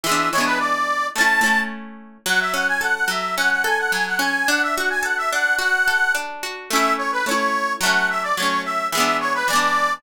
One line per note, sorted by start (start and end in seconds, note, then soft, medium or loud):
0.04 0.30 E3 medium
0.04 0.30 G#3 medium
0.04 0.29 E5 medium
0.09 0.30 B3 medium
0.09 0.30 D4 medium
0.32 1.09 E3 medium
0.32 1.09 G#3 medium
0.32 0.45 C#5 medium
0.38 1.09 B3 medium
0.38 1.09 D4 medium
0.45 0.59 B4 medium
0.59 1.07 D5 medium
1.16 1.41 A3 medium
1.16 1.41 C#4 medium
1.16 1.60 A5 medium
1.21 1.41 E4 medium
1.41 2.18 A3 medium
1.41 2.18 C#4 medium
1.46 2.18 E4 medium
2.26 3.07 F#3 loud
2.26 2.40 F#5 medium
2.40 2.53 E5 medium
2.54 3.37 C#4 medium
2.54 2.67 F#5 medium
2.68 2.81 G#5 medium
2.81 3.64 A4 medium
2.81 2.95 F#5 medium
2.95 3.08 F#5 medium
3.08 3.92 F#3 medium
3.08 3.35 E5 medium
3.37 4.19 C#4 medium
3.37 3.50 F#5 medium
3.51 3.64 F#5 medium
3.64 4.43 A4 loud
3.64 3.78 G#5 medium
3.79 3.92 F#5 medium
3.92 4.45 F#3 medium
3.92 4.06 G#5 medium
4.07 4.20 F#5 medium
4.19 4.45 C#4 medium
4.19 4.48 G#5 medium
4.48 5.32 D4 loud
4.48 4.62 F#5 medium
4.62 4.76 E5 medium
4.76 5.58 F#4 medium
4.76 4.89 F#5 medium
4.90 5.03 G#5 medium
5.03 5.87 A4 medium
5.03 5.17 F#5 medium
5.17 5.31 E5 medium
5.32 6.14 D4 medium
5.32 5.56 F#5 medium
5.59 6.43 F#4 medium
5.59 6.13 F#5 medium
5.88 6.67 A4 medium
6.15 6.67 D4 medium
6.43 6.69 F#4 medium
6.70 7.22 A3 medium
6.70 7.22 C#4 medium
6.70 6.93 E5 medium
6.76 7.22 E4 loud
6.98 7.11 C#5 medium
7.12 7.25 B4 medium
7.26 7.77 A3 medium
7.26 7.77 C#4 medium
7.26 7.73 C#5 medium
7.31 7.77 E4 medium
7.81 8.32 F#3 medium
7.81 8.32 A3 medium
7.81 8.08 F#5 medium
7.86 8.32 C#4 medium
8.10 8.23 E5 medium
8.23 8.36 D5 medium
8.37 8.89 F#3 medium
8.37 8.89 A3 medium
8.37 8.62 C#5 medium
8.42 8.89 C#4 medium
8.65 8.88 E5 medium
8.92 9.44 E3 medium
8.92 9.44 G#3 medium
8.92 9.17 E5 medium
8.98 9.44 B3 medium
8.98 9.44 D4 medium
9.20 9.34 C#5 medium
9.34 9.47 B4 medium
9.48 9.99 E3 medium
9.48 9.99 G#3 medium
9.48 9.94 D5 medium
9.53 9.99 B3 medium
9.53 9.99 D4 medium